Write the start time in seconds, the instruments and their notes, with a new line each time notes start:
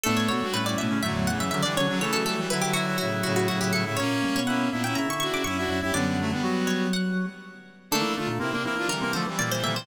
0.03 drawbar organ A2, clarinet A3 A4, brass section B3 D4, pizzicato strings A4
0.17 pizzicato strings C#5
0.28 drawbar organ B2, brass section D4 F#4, pizzicato strings C#5
0.41 drawbar organ G2, brass section D4 F#4
0.52 clarinet A2 A3, brass section C#4 E4, pizzicato strings B4
0.65 brass section C#4 E4, pizzicato strings D5
0.77 drawbar organ A2, clarinet B2 B3, pizzicato strings E5
0.90 clarinet C#3 C#4
1.02 drawbar organ F#2, clarinet A2 A3, brass section D3 F#3, pizzicato strings E5
1.14 drawbar organ E2
1.27 brass section C#3 E3, pizzicato strings F#5
1.38 drawbar organ F#2, pizzicato strings E5
1.51 clarinet C#3 C#4, brass section D3 F#3, drawbar organ D3, pizzicato strings E5
1.62 clarinet D3 D4, brass section E3 G3, pizzicato strings D5
1.76 drawbar organ C#3, clarinet D3 D4, brass section D3 F#3, pizzicato strings C#5
1.87 drawbar organ C#3, brass section D3 F#3, clarinet D3 D4
2.00 brass section C#3 E3, drawbar organ E3, clarinet A3 A4, pizzicato strings C#5
2.13 drawbar organ F#3, pizzicato strings A4
2.24 brass section E3 G3, pizzicato strings A4
2.36 brass section E3 G3
2.50 brass section D3 F#3, clarinet E4 E5, pizzicato strings B4
2.62 brass section D3 F#3, pizzicato strings G4
2.73 clarinet E4 E5, pizzicato strings F#4
2.87 clarinet E4 E5
2.98 brass section A2 C#3, clarinet E4 E5, pizzicato strings F#4
3.23 brass section A2 C#3, pizzicato strings F#4
3.36 pizzicato strings F#4
3.48 brass section A2 C#3, clarinet E4 E5, pizzicato strings F#4
3.60 brass section A2 C#3, clarinet E4 E5, pizzicato strings G4
3.73 brass section A2 C#3, clarinet E4 E5, pizzicato strings A4
3.85 brass section A2 C#3, clarinet E4 E5
3.97 drawbar organ A#2, brass section A#3 C#4, clarinet C#4 C#5, pizzicato strings C#5
4.24 drawbar organ G2
4.36 drawbar organ B2, pizzicato strings C#5
4.47 brass section A#3 C#4, clarinet E4 E5, pizzicato strings F#5
4.71 drawbar organ A#2, brass section B3 D4, clarinet E4 E5
4.83 brass section C#4 E4, clarinet E4 E5, pizzicato strings G5
4.95 drawbar organ C#3, clarinet E4 E5, pizzicato strings A#5
5.09 drawbar organ D3, pizzicato strings C#6
5.20 brass section D4 F#4, pizzicato strings C#6
5.32 drawbar organ C#3, pizzicato strings D6
5.44 drawbar organ F#2, brass section C#4 E4, clarinet E4 E5, pizzicato strings C#6
5.58 brass section D4 F#4, clarinet E4 E5
5.69 drawbar organ F#2, clarinet E4 E5
5.81 drawbar organ F#2, clarinet E4 E5, brass section E4 G4
5.92 drawbar organ F#2, clarinet D3 D4, brass section G3 B3, pizzicato strings D5
6.06 brass section G3 B3
6.19 brass section F#3 A3
6.31 brass section G3 B3
6.43 drawbar organ F#3, clarinet F#3 F#4
6.67 pizzicato strings C#5
6.93 pizzicato strings F#5
7.91 drawbar organ D3, clarinet A3 A4, brass section A#3 D4, pizzicato strings A4
8.01 drawbar organ E3
8.15 drawbar organ D3, clarinet A3 A4, brass section D4 F4
8.27 drawbar organ A#2
8.39 drawbar organ C3, clarinet A#3 A#4, brass section C4 E4
8.51 drawbar organ C3, brass section A#3 D4, clarinet A#3 A#4
8.63 drawbar organ E3, clarinet A#3 A#4, brass section C4 E4
8.75 drawbar organ E3, brass section D4 F4
8.88 drawbar organ D3, brass section E3 G3, pizzicato strings A#4
9.01 drawbar organ C3, clarinet A#3 A#4
9.12 brass section D3 F3, drawbar organ D3, clarinet A3 A4, pizzicato strings C5
9.27 drawbar organ E3, brass section E3 G3
9.38 clarinet A#2 A#3, drawbar organ E3, brass section E3 G3, pizzicato strings D5
9.51 brass section E3 G3, pizzicato strings C5
9.62 clarinet A#2 A#3, drawbar organ D3, brass section E3 G3, pizzicato strings E5
9.74 drawbar organ C3, brass section E3 G3, pizzicato strings C5